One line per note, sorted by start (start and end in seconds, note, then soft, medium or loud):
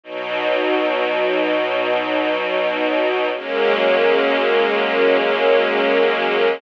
0.03 3.29 B2 loud
0.03 3.29 F#3 medium
0.03 3.29 D#4 medium
3.34 6.60 F#3 medium
3.34 6.60 G#3 medium
3.34 6.60 A#3 loud
3.34 6.60 C#4 loud